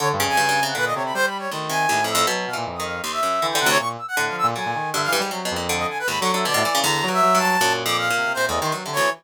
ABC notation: X:1
M:6/4
L:1/16
Q:1/4=158
K:none
V:1 name="Brass Section"
_d z2 _a4 _g B _e d b (3c2 b2 d2 z2 a4 =e'2 | z2 f z2 _e' f2 c' =e4 g _g _d _d' z =e' g2 f e' z | _a4 e f z7 _e a B (3b2 _d'2 =e2 =d4 | _b3 e3 a4 z d' f4 (3c2 _e2 c'2 z2 _d2 |]
V:2 name="Brass Section" clef=bass
(3D,2 G,,2 F,,2 _D,4 _B,,2 C,2 G,4 _E,4 A,,4 | _G,2 B,, _B,, F,,4 z4 E,2 C,2 B,,2 z2 (3A,,2 F,2 B,,2 | _G, _B,, _E,2 (3D,2 =E,2 =G,2 _G,2 F,,4 z2 (3_A,,2 G,2 G,2 D, =A,, E,2 | D,2 _G,2 G,4 _B,,6 C, C, (3B,,2 E,,2 _E,2 (3G,2 D,2 =E,2 |]
V:3 name="Orchestral Harp" clef=bass
D,2 _D,2 (3G,,2 G,,2 C,2 =D,6 z2 D,,2 C,2 (3_E,,2 F,,2 F,,2 | (3B,,4 E,4 _E,4 _E,,2 _G,,2 (3D,2 D,2 D,,2 z4 D,4 | D,4 G,,2 G,, _A,, (3C,2 B,,2 _B,,2 D,4 (3_E,,2 D,2 D,2 =B,, B,, =E, _D, | (3E,,4 G,,4 G,,4 (3_G,,4 F,,4 _B,,4 (3C,2 A,,2 C,2 (3=G,,2 C,2 D,,2 |]